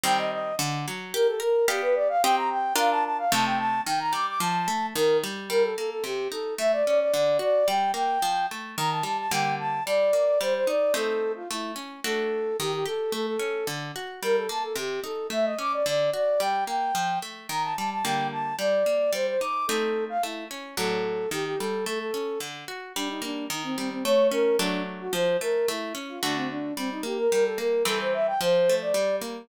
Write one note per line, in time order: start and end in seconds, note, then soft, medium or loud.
0.04 0.53 D#3 loud
0.04 0.53 G3 loud
0.04 0.53 C4 loud
0.04 0.18 G5 medium
0.18 0.31 D#5 medium
0.32 0.55 D#5 medium
0.59 0.86 D3 loud
0.88 1.14 F#3 medium
1.14 1.41 G4 loud
1.14 1.27 A#4 medium
1.27 1.40 A4 medium
1.40 1.66 A#4 medium
1.68 2.17 B3 loud
1.68 2.17 G4 loud
1.68 1.81 G4 medium
1.68 2.17 D5 medium
1.68 2.17 F5 loud
1.82 1.95 B4 medium
1.95 2.08 D5 medium
2.09 2.22 F5 medium
2.23 2.73 C4 loud
2.23 2.73 G4 loud
2.23 2.73 D#5 loud
2.23 2.36 G5 loud
2.36 2.49 A#5 medium
2.50 2.74 G5 medium
2.76 3.25 D4 loud
2.76 3.25 F4 loud
2.76 3.25 A#4 loud
2.76 2.90 F5 medium
2.91 3.04 A5 medium
3.04 3.17 A5 medium
3.18 3.31 F5 medium
3.32 3.81 C3 loud
3.32 3.81 A3 loud
3.32 3.81 D#4 loud
3.32 3.45 A5 medium
3.45 3.58 G5 medium
3.58 3.81 A5 medium
3.86 4.14 D#3 medium
3.86 3.99 G5 medium
3.99 4.12 A#5 medium
4.13 4.39 G3 medium
4.13 4.26 D6 medium
4.27 4.40 D6 medium
4.40 4.68 F3 loud
4.40 4.86 A5 medium
4.68 4.94 A3 medium
4.95 5.23 D#3 loud
4.95 5.17 A#4 medium
5.24 5.49 G3 medium
5.50 5.74 G3 medium
5.50 5.63 A#4 medium
5.63 5.76 A4 medium
5.77 6.03 A#3 medium
5.77 5.90 A4 medium
5.90 6.03 A4 medium
6.04 6.28 C3 medium
6.04 6.28 G4 medium
6.32 6.56 D#4 medium
6.32 6.54 A4 medium
6.58 6.83 A3 medium
6.58 6.72 E5 medium
6.73 6.85 D5 medium
6.86 7.12 C#4 medium
6.86 6.99 D5 medium
7.00 7.13 D5 medium
7.14 7.38 D3 medium
7.14 7.38 D5 medium
7.39 7.64 F#4 medium
7.39 7.67 D5 medium
7.68 7.92 G3 medium
7.68 7.91 G5 medium
7.94 8.18 A#3 medium
7.94 8.46 G5 medium
8.22 8.47 F3 medium
8.51 8.76 A3 medium
8.77 9.02 D#3 medium
8.77 8.90 A#5 medium
8.91 9.04 A5 medium
9.03 9.28 G3 medium
9.03 9.17 A5 medium
9.18 9.31 A5 medium
9.31 9.80 D3 medium
9.31 9.80 G3 medium
9.31 9.80 A#3 medium
9.31 9.55 G5 medium
9.59 9.83 A5 medium
9.86 10.11 G3 medium
9.86 10.39 D5 medium
10.13 10.38 A#3 medium
10.41 10.65 G3 medium
10.41 10.54 C5 medium
10.55 10.68 C5 medium
10.67 10.92 D#4 medium
10.67 10.93 D5 medium
10.94 11.43 A3 medium
10.94 11.43 C4 medium
10.94 11.43 D#4 medium
10.94 11.32 A4 medium
11.36 11.49 F4 medium
11.50 11.75 A3 medium
11.50 11.72 E4 medium
11.76 12.00 C#4 medium
12.04 12.53 A3 medium
12.04 12.53 D4 medium
12.04 12.53 F#4 medium
12.04 12.57 A4 medium
12.59 12.84 D#3 medium
12.59 12.72 G4 medium
12.73 12.86 G4 medium
12.86 13.10 G4 medium
12.86 13.13 A4 medium
13.12 13.37 A3 medium
13.12 13.26 A4 medium
13.27 13.67 A4 medium
13.39 13.64 C#4 medium
13.67 13.92 D3 medium
13.96 14.20 F#4 medium
14.23 14.47 G3 medium
14.23 14.36 A#4 medium
14.36 14.49 A4 medium
14.49 14.74 A#3 medium
14.49 14.63 A5 medium
14.63 14.76 A4 medium
14.76 15.00 C3 medium
14.76 15.00 G4 medium
15.04 15.28 D#4 medium
15.04 15.27 A4 medium
15.30 15.55 A3 medium
15.30 15.45 E5 medium
15.45 15.58 D#5 medium
15.59 15.83 C#4 medium
15.59 15.72 D6 medium
15.73 15.86 D5 medium
15.86 16.10 D3 medium
15.86 16.10 D5 medium
16.14 16.38 F#4 medium
16.14 16.41 D5 medium
16.40 16.65 G3 medium
16.40 16.64 G5 medium
16.67 16.92 A#3 medium
16.67 17.19 G5 medium
16.95 17.19 F3 medium
17.22 17.47 A3 medium
17.49 17.74 D#3 medium
17.49 17.62 A#5 medium
17.63 17.76 A5 medium
17.77 18.03 G3 medium
17.77 17.90 A5 medium
17.91 18.04 A5 medium
18.04 18.54 D3 medium
18.04 18.54 G3 medium
18.04 18.54 A#3 medium
18.04 18.27 G5 medium
18.32 18.56 A5 medium
18.59 18.83 G3 medium
18.59 19.11 D5 medium
18.86 19.11 A#3 medium
19.13 19.37 G3 medium
19.13 19.26 C5 medium
19.27 19.40 C5 medium
19.40 19.66 D#4 medium
19.40 19.66 D6 medium
19.67 20.18 A3 medium
19.67 20.18 C4 medium
19.67 20.18 D#4 medium
19.67 20.05 A4 medium
20.09 20.22 F5 medium
20.23 20.48 A3 medium
20.23 20.45 E4 medium
20.51 20.75 C#4 medium
20.77 21.26 A2 medium
20.77 21.26 F#3 medium
20.77 21.26 D4 medium
20.77 21.29 A4 medium
21.31 21.56 D#3 medium
21.31 21.45 G4 medium
21.45 21.58 G4 medium
21.59 21.85 G3 medium
21.59 21.85 A4 medium
21.86 22.11 A3 medium
21.86 21.99 A4 medium
21.99 22.39 A4 medium
22.14 22.38 C#4 medium
22.40 22.65 D3 medium
22.68 22.93 F#4 medium
22.95 23.48 G3 medium
22.95 23.08 D4 medium
23.09 23.22 D#4 medium
23.22 23.48 A#3 medium
23.22 23.45 D4 medium
23.50 24.02 D#3 medium
23.50 23.63 D#4 medium
23.64 23.76 C4 medium
23.77 24.04 G3 medium
23.77 23.90 C4 medium
23.90 24.03 C4 medium
24.04 24.57 A3 medium
24.04 24.27 C#5 medium
24.31 24.57 C#4 medium
24.31 24.56 A#4 medium
24.59 25.08 F#3 medium
24.59 25.08 A3 medium
24.59 24.82 D4 medium
24.59 25.08 D4 medium
24.99 25.12 F#4 medium
25.13 25.37 F3 loud
25.13 25.37 C5 medium
25.41 25.66 A3 medium
25.41 25.67 A#4 medium
25.68 25.93 A3 medium
25.68 25.94 E4 medium
25.95 26.19 C#4 medium
26.09 26.22 F4 medium
26.22 26.72 D3 medium
26.22 26.72 A3 medium
26.22 26.35 D4 medium
26.22 26.72 F#4 medium
26.36 26.49 C4 medium
26.50 26.74 D4 medium
26.77 27.02 G3 medium
26.77 26.90 C4 medium
26.91 27.04 D#4 medium
27.03 27.28 A#3 medium
27.03 27.18 G4 medium
27.18 27.31 A#4 medium
27.31 27.84 G3 medium
27.31 27.44 A#4 medium
27.45 27.58 A4 medium
27.58 27.84 A#3 medium
27.58 27.83 A#4 medium
27.85 28.34 E3 medium
27.85 28.34 G3 medium
27.85 28.34 C4 medium
27.85 27.99 A4 medium
28.00 28.13 C5 medium
28.14 28.26 E5 medium
28.27 28.40 G5 medium
28.41 28.93 F3 loud
28.41 28.75 C5 medium
28.69 28.95 A3 medium
28.81 29.16 D5 medium
28.94 29.46 G3 medium
29.21 29.47 A#3 medium